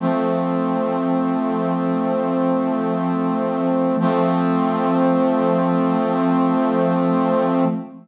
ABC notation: X:1
M:4/4
L:1/8
Q:1/4=60
K:F
V:1 name="Brass Section"
[F,A,C]8 | [F,A,C]8 |]